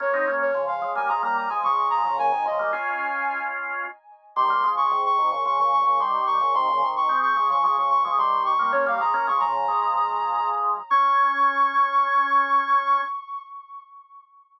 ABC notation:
X:1
M:4/4
L:1/16
Q:1/4=110
K:Dblyd
V:1 name="Ocarina"
d3 d2 f2 a b b b a d'2 b2 | a2 e2 a6 z6 | c'3 d'2 d'2 d' d' d' d' d' c'2 d'2 | c'3 d'2 d'2 d' d' d' d' d' c'2 d'2 |
d f b2 d' b9 z2 | d'16 |]
V:2 name="Drawbar Organ"
[B,D] [CE] [B,D]2 [D,F,]2 [F,A,] [G,B,] [F,A,] [G,B,]2 [F,A,] [F,A,]3 [D,F,] | [B,,D,] [C,E,] [D,F,] [G,B,] [DF]10 z2 | [E,G,] [G,B,] [F,A,]2 [A,,C,]2 [C,E,] [B,,D,] [D,F,] [B,,D,]2 [B,,D,] [E,G,]3 [B,,D,] | [C,E,] [B,,D,] [C,E,]2 [A,C]2 [F,A,] [D,F,] [F,A,] [D,F,]2 [F,A,] [E,G,]3 [G,B,] |
[B,D] [G,B,] [F,A,] [B,D] [F,A,] [D,F,]2 [F,A,]9 | D16 |]